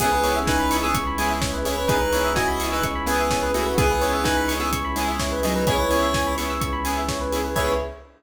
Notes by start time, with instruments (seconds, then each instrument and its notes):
0.00 synth bass 2 C#2, pad 5 (bowed) B3 C#4 E4 G#4, lead 1 (square) B3 G#4, lead 2 (sawtooth) B3 C#4 E4 G#4, electric piano 2 G#4, kick, crash
0.12 electric piano 2 B4
0.22 lead 2 (sawtooth) B3 C#4 E4 G#4, electric piano 2 C#5, open hi-hat
0.36 electric piano 2 E5
0.47 lead 1 (square) D#4 B4, electric piano 2 G#5, kick, snare
0.59 electric piano 2 B5
0.70 lead 2 (sawtooth) B3 C#4 E4 G#4, electric piano 2 C#6, snare, open hi-hat
0.83 lead 1 (square) B3 G#4, electric piano 2 E6
0.94 synth bass 2 C#2, electric piano 2 C#6, kick, closed hi-hat
1.07 electric piano 2 B5
1.18 lead 1 (square) G#3 E4, lead 2 (sawtooth) B3 C#4 E4 G#4, electric piano 2 G#5, open hi-hat
1.30 electric piano 2 E5
1.41 electric piano 2 C#5, kick, snare
1.53 electric piano 2 B4
1.65 lead 2 (sawtooth) B3 C#4 E4 G#4, lead 1 (square) E4 C#5, electric piano 2 G#4, open hi-hat
1.78 electric piano 2 B4
1.88 synth bass 2 C#2, pad 5 (bowed) B3 C#4 E4 G#4, lead 2 (sawtooth) B3 C#4 E4 G#4, lead 1 (square) D#4 B4, electric piano 2 G#4, kick, closed hi-hat
2.01 electric piano 2 B4
2.13 lead 2 (sawtooth) B3 C#4 E4 G#4, electric piano 2 C#5, open hi-hat
2.24 electric piano 2 E5
2.36 lead 1 (square) F#4 D#5, electric piano 2 G#5, kick, snare
2.48 electric piano 2 B5
2.60 lead 2 (sawtooth) B3 C#4 E4 G#4, electric piano 2 C#6, snare, open hi-hat
2.72 lead 1 (square) D#4 B4, electric piano 2 E6
2.82 synth bass 2 C#2, electric piano 2 C#6, kick, closed hi-hat
2.95 electric piano 2 B5
3.06 lead 2 (sawtooth) B3 C#4 E4 G#4, lead 1 (square) B3 G#4, electric piano 2 G#5, open hi-hat
3.19 electric piano 2 E5
3.31 electric piano 2 C#5, kick, snare
3.43 electric piano 2 B4
3.54 lead 1 (square) A3 F#4, lead 2 (sawtooth) B3 C#4 E4 G#4, electric piano 2 G#4, open hi-hat
3.66 electric piano 2 B4
3.76 synth bass 2 C#2, lead 2 (sawtooth) B3 C#4 E4 G#4, lead 1 (square) B3 G#4, pad 5 (bowed) B3 C#4 E4 G#4, electric piano 2 G#4, kick, closed hi-hat
3.91 electric piano 2 B4
4.01 lead 2 (sawtooth) B3 C#4 E4 G#4, electric piano 2 C#5, open hi-hat
4.13 electric piano 2 E5
4.24 lead 1 (square) D#4 B4, electric piano 2 G#5, kick, snare
4.37 electric piano 2 B5
4.48 lead 2 (sawtooth) B3 C#4 E4 G#4, electric piano 2 C#6, snare, open hi-hat
4.60 lead 1 (square) B3 G#4, electric piano 2 E6
4.71 synth bass 2 C#2, electric piano 2 C#6, kick, closed hi-hat
4.85 electric piano 2 B5
4.96 lead 1 (square) G#3 E4, lead 2 (sawtooth) B3 C#4 E4 G#4, electric piano 2 G#5, open hi-hat
5.08 electric piano 2 E5
5.19 electric piano 2 C#5, kick, snare
5.32 electric piano 2 B4
5.43 lead 1 (square) F#3 D#4, lead 2 (sawtooth) B3 C#4 E4 G#4, electric piano 2 G#4, open hi-hat
5.56 electric piano 2 B4
5.67 synth bass 2 C#2, pad 5 (bowed) B3 C#4 E4 G#4, lead 2 (sawtooth) B3 C#4 E4 G#4, lead 1 (square) E4 C#5, electric piano 2 G#4, kick, closed hi-hat
5.79 electric piano 2 B4
5.89 lead 2 (sawtooth) B3 C#4 E4 G#4, electric piano 2 C#5, open hi-hat
6.02 electric piano 2 E5
6.14 electric piano 2 G#5, kick, snare
6.27 electric piano 2 B5
6.37 lead 2 (sawtooth) B3 C#4 E4 G#4, electric piano 2 C#6, snare, open hi-hat
6.50 electric piano 2 E6
6.61 synth bass 2 C#2, electric piano 2 C#6, kick, closed hi-hat
6.73 electric piano 2 B5
6.85 lead 2 (sawtooth) B3 C#4 E4 G#4, electric piano 2 G#5, open hi-hat
6.97 electric piano 2 E5
7.09 electric piano 2 C#5, kick, snare
7.21 electric piano 2 B4
7.32 lead 2 (sawtooth) B3 C#4 E4 G#4, electric piano 2 G#4, open hi-hat
7.44 electric piano 2 B4
7.56 synth bass 2 C#2, pad 5 (bowed) B3 C#4 E4 G#4, lead 2 (sawtooth) B3 C#4 E4 G#4, electric piano 2 G#4 B4 C#5 E5, lead 1 (square) C#5, kick, crash